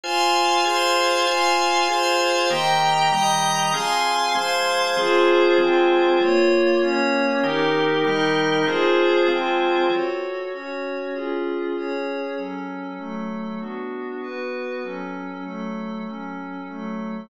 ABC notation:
X:1
M:3/4
L:1/8
Q:1/4=146
K:Fm
V:1 name="Drawbar Organ"
[Fca]3 [FAa]3 | [Fca]3 [FAa]3 | [E,B,G]3 [E,G,G]3 | [F,CA]3 [F,A,A]3 |
[F,CA]3 [F,A,A]3 | z6 | [E,B,G]3 [E,G,G]3 | [F,CA]3 [F,A,A]3 |
[K:F#m] z6 | z6 | z6 | z6 |
z6 | z6 |]
V:2 name="Pad 5 (bowed)"
[fac']3 [cfc']3 | [fac']3 [cfc']3 | [egb]3 [ebe']3 | [fac']3 [cfc']3 |
[FAc]3 [CFc]3 | [B,Fd]3 [B,Dd]3 | [EGB]3 [EBe]3 | [FAc]3 [CFc]3 |
[K:F#m] [FAc]3 [CFc]3 | [C^EG]3 [CGc]3 | [F,CA]3 [F,A,A]3 | [B,DF]3 [B,FB]3 |
[F,CA]3 [F,A,A]3 | [F,CA]3 [F,A,A]3 |]